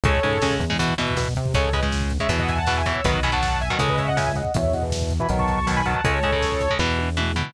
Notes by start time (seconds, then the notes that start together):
0.03 C#2 C#3 G#3 A4 C#5, kick, closed hi-hat
0.15 kick
0.23 G#2 C#3 G#3, kick, closed hi-hat
0.33 kick
0.42 C#3 G#3, kick, snare
0.51 kick
0.59 E2, kick, closed hi-hat
0.70 C#3 G#3, kick
0.79 B2 E3, kick, closed hi-hat
0.89 kick
0.98 B2 E3, kick, closed hi-hat
1.08 kick
1.16 B2, kick, snare
1.25 kick
1.35 C3, kick, closed hi-hat
1.46 kick
1.54 C#2 C#3 G#3 A4 C#5, kick, closed hi-hat
1.64 kick
1.73 C#3 G#3 B4 D#5, kick, closed hi-hat
1.83 C#3 G#3, kick
1.92 kick, snare
2.01 kick
2.10 kick, closed hi-hat
2.19 C#3 G#3 C#5 E5, kick
2.29 E2 B2 E3, kick, closed hi-hat
2.39 D#5 F#5, kick
2.48 E5 G#5, kick, closed hi-hat
2.58 F#5 A5, kick
2.66 B2 E3 F#5 A5, kick, snare
2.76 E5 G#5, kick
2.86 B2 E3 C#5 E5, kick, closed hi-hat
2.96 kick
3.04 B1 B2 D#3 F#3 B4 D#5, kick, closed hi-hat
3.14 kick
3.23 B2 D#3 F#3 G#5 B5, kick, closed hi-hat
3.32 B2 D#3 F#3 F#5 A5, kick
3.42 kick, snare
3.52 kick
3.60 E5 G#5, kick, closed hi-hat
3.70 B2 D#3 F#3 D#5 F#5, kick
3.78 C#2 C#3 G#3 A4 C#5, kick, closed hi-hat
3.89 B4 D#5, kick
3.98 C#5 E5, kick, closed hi-hat
4.08 D#5 F#5, kick
4.17 C#3 G#3 E5 G#5, kick, snare
4.26 E5 G#5, kick
4.35 C#3 G#3 D#5 F#5, kick, closed hi-hat
4.45 kick
4.54 E2 B2 E3 C#5 E5, kick, closed hi-hat
4.64 kick
4.73 B2 E3 D#5 F#5, kick, closed hi-hat
4.82 B2 E3, kick
4.91 kick, snare
5.01 kick
5.10 kick, closed hi-hat
5.20 B2 E3 G#5 B5, kick
5.29 B1 B2 D#3 F#3, kick, closed hi-hat
5.39 A5 C#6, kick
5.48 A5 C#6, kick, closed hi-hat
5.58 A5 C#6, kick
5.67 B2 D#3 F#3 A5 C#6, kick, snare
5.76 G#5 B5, kick
5.85 B2 D#3 F#3 F#5 A5, kick, closed hi-hat
5.94 kick
6.04 C#2 C#3 G#3 A4 C#5, kick, closed hi-hat
6.23 C#3 G#3, kick, closed hi-hat
6.32 C#3 G#3, kick
6.41 kick, snare
6.52 kick
6.61 kick, closed hi-hat
6.70 C#3 G#3, kick
6.79 E2 B2 E3, kick, snare
6.99 high tom
7.17 B2 E3, mid tom
7.36 B2 E3, floor tom